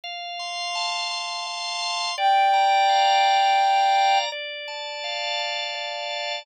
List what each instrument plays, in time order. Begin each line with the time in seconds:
0.04 drawbar organ F5
0.39 drawbar organ C6
0.75 drawbar organ A5
1.11 drawbar organ C6
1.47 drawbar organ F5
1.82 drawbar organ C6
2.18 drawbar organ D5, ocarina G5
2.53 drawbar organ A#5
2.89 drawbar organ F5
3.25 drawbar organ A#5
3.61 drawbar organ D5
3.96 drawbar organ A#5
4.32 drawbar organ D5
4.68 drawbar organ A5
5.04 drawbar organ F5
5.39 drawbar organ A5
5.75 drawbar organ D5
6.10 drawbar organ A5